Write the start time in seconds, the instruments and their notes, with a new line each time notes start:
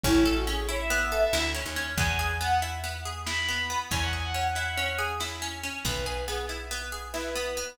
0.03 electric bass (finger) A1, pizzicato strings C#4, violin E4, kick, closed hi-hat
0.25 violin E4, pizzicato strings A4
0.36 violin F#4, closed hi-hat
0.47 pizzicato strings C#4, violin G#4
0.68 pizzicato strings E4, violin C#5, closed hi-hat
0.80 violin E5
0.90 pizzicato strings B3
1.01 closed hi-hat
1.12 pizzicato strings A4
1.33 electric bass (finger) D2, pizzicato strings E4, snare
1.54 pizzicato strings C#4
1.66 electric bass (finger) D#2, closed hi-hat
1.76 pizzicato strings C#4
1.97 electric bass (finger) E2, pizzicato strings B3, violin G#5, kick, closed hi-hat
2.19 pizzicato strings G#4, violin G#5
2.30 closed hi-hat
2.41 pizzicato strings B3, violin F#5
2.62 pizzicato strings E4, closed hi-hat
2.84 pizzicato strings B3
2.95 closed hi-hat
3.05 pizzicato strings G#4
3.26 pizzicato strings E4, violin B5, snare
3.48 pizzicato strings B3
3.59 closed hi-hat
3.70 pizzicato strings B3
3.91 electric bass (finger) E2, pizzicato strings C#4, violin G#5, kick, closed hi-hat
4.01 violin F#5
4.13 pizzicato strings G#4, violin G#5
4.24 violin F#5, closed hi-hat
4.34 pizzicato strings C#4
4.55 pizzicato strings E4, closed hi-hat
4.77 pizzicato strings C#4
4.88 closed hi-hat
4.98 pizzicato strings G#4
5.20 pizzicato strings E4, snare
5.42 pizzicato strings C#4
5.52 closed hi-hat
5.63 pizzicato strings C#4
5.85 electric bass (finger) B1, pizzicato strings B3, violin B4, kick, closed hi-hat
6.06 pizzicato strings G#4, violin B4
6.17 closed hi-hat
6.27 pizzicato strings B3, violin G#4
6.49 pizzicato strings E4, closed hi-hat
6.71 pizzicato strings B3
6.81 closed hi-hat
6.92 pizzicato strings G#4
7.13 pizzicato strings E4, violin B4, snare
7.35 pizzicato strings B3
7.46 closed hi-hat
7.57 pizzicato strings B3